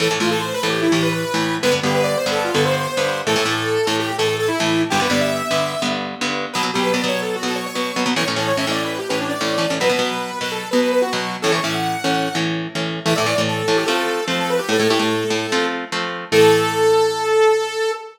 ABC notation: X:1
M:4/4
L:1/16
Q:1/4=147
K:Am
V:1 name="Lead 2 (sawtooth)"
A z F A (3c2 B2 G2 E G B B5 | B z G B (3d2 c2 A2 F A c c5 | A6 A G2 A A A E4 | G B d e7 z6 |
[K:Bm] B z G B (3d2 c2 A2 F A c c5 | c z A c (3e2 d2 B2 G B D d5 | B6 B A2 B B B F4 | A c e f7 z6 |
[K:Am] e d3 A3 G A4 c A B G | A A G A7 z6 | A16 |]
V:2 name="Overdriven Guitar"
[A,,E,A,] [A,,E,A,] [A,,E,A,]4 [A,,E,A,]3 [A,,E,A,]4 [A,,E,A,]3 | [G,,D,B,] [G,,D,B,] [G,,D,B,]4 [G,,D,B,]3 [G,,D,B,]4 [G,,D,B,]3 | [A,,E,A,] [A,,E,A,] [A,,E,A,]4 [A,,E,A,]3 [A,,E,A,]4 [A,,E,A,]3 | [G,,D,B,] [G,,D,B,] [G,,D,B,]4 [G,,D,B,]3 [G,,D,B,]4 [G,,D,B,]3 |
[K:Bm] [B,,F,B,] [B,,F,B,] [B,,F,B,]2 [B,,F,B,] [B,,F,B,]4 [B,,F,B,]3 [B,,F,B,]2 [B,,F,B,] [B,,F,B,] | [A,,E,C] [A,,E,C] [A,,E,C]2 [A,,E,C] [A,,E,C]4 [A,,E,C]3 [A,,E,C]2 [A,,E,C] [A,,E,C] | [B,,F,B,] [B,,F,B,] [B,,F,B,]4 [B,,F,B,]3 [B,,F,B,]4 [B,,F,B,]3 | [A,,E,C] [A,,E,C] [A,,E,C]4 [A,,E,C]3 [A,,E,C]4 [A,,E,C]3 |
[K:Am] [A,,E,A,] [A,,E,A,] [A,,E,A,] [A,,E,A,]3 [A,,E,A,]2 [F,A,C]4 [F,A,C]4 | [A,,A,E] [A,,A,E] [A,,A,E] [A,,A,E]3 [A,,A,E]2 [F,A,C]4 [F,A,C]4 | [A,,E,A,]16 |]